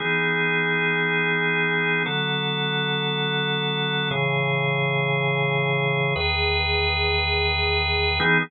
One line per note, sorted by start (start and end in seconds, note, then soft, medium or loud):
0.00 2.03 E3 medium
0.00 2.03 B3 medium
0.00 2.03 D#4 medium
0.00 2.03 G#4 medium
2.06 4.09 D3 medium
2.06 4.09 F#3 medium
2.06 4.09 B3 medium
2.06 4.09 A4 medium
4.11 6.14 A2 medium
4.11 6.14 C#3 medium
4.11 6.14 E3 medium
4.11 6.14 G#4 medium
6.16 8.19 E2 medium
6.16 8.19 D#3 medium
6.16 8.19 G#4 medium
6.16 8.19 B4 medium
8.20 8.38 E3 loud
8.20 8.38 B3 loud
8.20 8.38 D#4 loud
8.20 8.38 G#4 medium